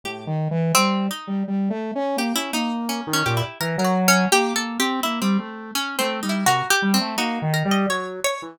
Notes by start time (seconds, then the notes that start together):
0.04 A2 G4
0.27 D#3
0.51 E3
0.75 G3 C4
1.11 D#4
1.27 G3
1.48 G3
1.70 A3
1.95 C#4
2.17 A#3 G4
2.35 C#4 E4
2.53 A#3 D#4
2.89 C#4
3.07 D#3
3.13 C#4
3.26 A#2 G4
3.37 E4
3.60 E3 A#4
3.78 F#3 A#4
3.85 F#4
4.08 C#4
4.32 A#3 G4
4.56 A#3 A4
4.79 C4 G4
5.03 A#3 E4
5.22 G3 C4
5.39 A3
5.75 C#4
5.99 A3 C4
6.23 G3 D#4
6.29 E4
6.46 C3 F#4 A#4
6.70 G4
6.82 G3
6.94 C4
7.01 A3
7.18 A#3 D#4 F#4
7.42 D#3
7.54 A#4
7.65 G3
7.71 D#5
7.88 F#3 C#5
8.24 C#5
8.42 E3